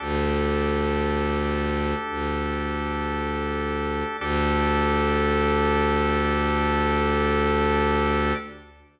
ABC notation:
X:1
M:4/4
L:1/8
Q:1/4=57
K:Dmix
V:1 name="Drawbar Organ"
[DGA]8 | [DGA]8 |]
V:2 name="Violin" clef=bass
D,,4 D,,4 | D,,8 |]